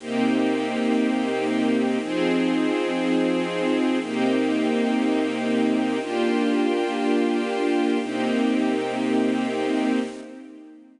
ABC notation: X:1
M:4/4
L:1/8
Q:1/4=120
K:Cm
V:1 name="String Ensemble 1"
[C,B,EG]8 | [F,CEA]8 | [C,B,EG]8 | [B,DFG]8 |
[C,B,EG]8 |]